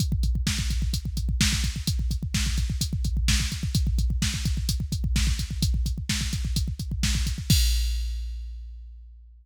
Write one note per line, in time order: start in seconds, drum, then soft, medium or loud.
0.00 kick medium
0.00 closed hi-hat medium
0.12 kick medium
0.23 kick medium
0.23 closed hi-hat medium
0.35 kick medium
0.47 kick medium
0.47 snare medium
0.59 kick medium
0.70 kick medium
0.70 closed hi-hat medium
0.82 kick medium
0.93 kick medium
0.93 closed hi-hat medium
1.05 kick medium
1.17 kick medium
1.17 closed hi-hat medium
1.29 kick medium
1.41 kick medium
1.41 snare loud
1.53 kick medium
1.64 kick medium
1.64 closed hi-hat medium
1.76 kick medium
1.87 kick medium
1.87 closed hi-hat medium
1.99 kick medium
2.11 kick medium
2.11 closed hi-hat medium
2.23 kick medium
2.34 kick medium
2.34 snare medium
2.46 kick medium
2.58 kick medium
2.58 closed hi-hat medium
2.70 kick medium
2.81 kick medium
2.81 closed hi-hat medium
2.93 kick medium
3.04 kick medium
3.04 closed hi-hat medium
3.17 kick medium
3.28 kick medium
3.28 snare loud
3.40 kick medium
3.52 kick medium
3.52 closed hi-hat medium
3.63 kick medium
3.75 kick medium
3.75 closed hi-hat medium
3.87 kick medium
3.98 kick medium
3.98 closed hi-hat medium
4.10 kick medium
4.22 kick medium
4.22 snare medium
4.34 kick medium
4.45 kick medium
4.45 closed hi-hat medium
4.57 kick medium
4.69 kick medium
4.69 closed hi-hat medium
4.80 kick medium
4.92 kick medium
4.92 closed hi-hat medium
5.04 kick medium
5.16 kick medium
5.16 snare medium
5.27 kick medium
5.39 kick medium
5.39 closed hi-hat medium
5.51 kick medium
5.62 kick medium
5.62 closed hi-hat medium
5.74 kick medium
5.86 kick medium
5.86 closed hi-hat medium
5.98 kick medium
6.09 kick medium
6.09 snare medium
6.21 kick medium
6.33 kick medium
6.33 closed hi-hat medium
6.45 kick medium
6.56 kick medium
6.56 closed hi-hat medium
6.68 kick medium
6.79 kick medium
6.79 closed hi-hat medium
6.92 kick medium
7.03 kick medium
7.03 snare medium
7.15 kick medium
7.27 kick medium
7.27 closed hi-hat medium
7.38 kick medium
7.50 kick loud
7.50 crash loud